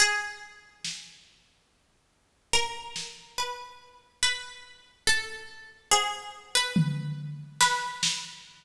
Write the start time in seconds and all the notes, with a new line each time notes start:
0.00 G#4
0.85 snare
2.53 A#4
2.96 snare
3.38 B4
4.23 B4
5.07 A4
5.91 G#4, cowbell
6.55 B4
6.76 floor tom
7.61 B4, snare
8.03 snare